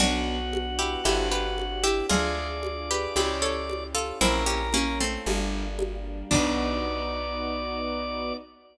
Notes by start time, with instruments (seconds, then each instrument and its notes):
0.00 electric bass (finger) B1, acoustic grand piano B3 D4 F#4, string ensemble 1 B3 D4 F#4, pizzicato strings D4 F#4, drawbar organ F#4, cowbell, low conga
0.53 high conga
0.79 pizzicato strings E4 G4
1.04 electric bass (finger) G1, string ensemble 1 C4 D4 G4, acoustic grand piano C4 D4 G4, pizzicato strings E4 G4, cowbell, high conga
1.31 pizzicato strings G4 B4
1.58 high conga
1.84 pizzicato strings E4 G4
2.09 electric bass (finger) D2, acoustic grand piano D4 F4 G#4, string ensemble 1 D4 F4 G#4, pizzicato strings F4 G#4, drawbar organ D5, cowbell, low conga
2.63 high conga
2.91 pizzicato strings G4 B4
3.16 electric bass (finger) C#2, acoustic grand piano C#4 E4 G4, string ensemble 1 C#4 E4 G4, pizzicato strings E4 G4, cowbell, high conga
3.42 pizzicato strings A4 C#5
3.70 high conga
3.95 pizzicato strings F4 A4
4.21 electric bass (finger) A#1, acoustic grand piano A#3 C#4 E4, string ensemble 1 A#3 C#4 E4, pizzicato strings C4 E4, drawbar organ A#4, cowbell, low conga
4.46 pizzicato strings C#4 G4
4.73 pizzicato strings A#3 C#4, high conga
5.00 pizzicato strings A3 C4
5.26 electric bass (finger) G1, acoustic grand piano G3 A#3 D4, string ensemble 1 G3 A#3 D4, cowbell, high conga
5.79 high conga
6.31 electric bass (finger) B1, acoustic grand piano B3 D#4 F#4, string ensemble 1 B3 D#4 F#4, pizzicato strings D4, drawbar organ D5, kick, crash